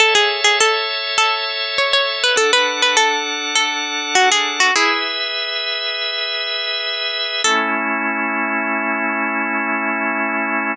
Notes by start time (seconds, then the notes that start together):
0.00 A4 C#5 E5
0.15 G#4
0.44 G#4
0.61 A4
1.18 A4
1.78 C#5
1.93 C#5
2.24 B4
2.36 D4 A4 F#5
2.53 B4
2.82 B4
2.97 A4
3.55 A4
4.15 F#4
4.32 G#4
4.60 F#4
4.76 E4 G#4 B4 E5
7.44 A3 C#4 E4 A4